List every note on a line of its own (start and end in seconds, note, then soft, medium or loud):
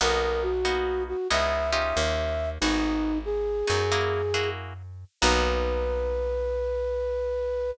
0.01 1.14 B1 medium
0.01 0.53 A#3 medium
0.01 0.53 B3 loud
0.01 0.53 D#4 medium
0.01 0.53 F#4 medium
0.01 0.43 A#4 loud
0.43 1.03 F#4 loud
0.65 1.17 A#3 medium
0.65 1.17 B3 medium
0.65 1.17 D#4 medium
0.65 1.17 F#4 medium
1.08 1.28 F#4 medium
1.30 1.93 C#2 medium
1.30 1.71 B3 medium
1.30 1.71 C#4 medium
1.30 1.71 D#4 medium
1.30 1.71 E4 medium
1.30 1.71 E5 loud
1.71 2.47 C#4 medium
1.71 2.47 D#4 medium
1.71 2.47 F4 medium
1.71 2.47 G4 medium
1.71 2.50 E5 medium
1.97 2.58 D#2 medium
2.61 3.63 G#1 medium
2.61 3.14 B3 medium
2.61 3.18 D#4 loud
2.61 3.14 D#4 medium
2.61 3.14 F#4 medium
2.61 3.14 G#4 medium
3.25 4.50 G#4 loud
3.67 5.05 F#2 medium
3.67 3.83 B3 medium
3.67 3.83 D#4 medium
3.67 3.83 F#4 medium
3.67 3.83 G#4 medium
3.92 4.22 A#3 medium
3.92 4.22 E4 medium
3.92 4.22 F#4 medium
3.92 4.22 G#4 medium
4.34 4.73 A#3 medium
4.34 4.73 E4 medium
4.34 4.73 F#4 medium
4.34 4.73 G#4 medium
5.21 7.72 B1 loud
5.21 7.71 A#3 loud
5.21 7.71 B3 loud
5.21 7.71 D#4 medium
5.21 7.71 F#4 loud
5.21 7.71 B4 loud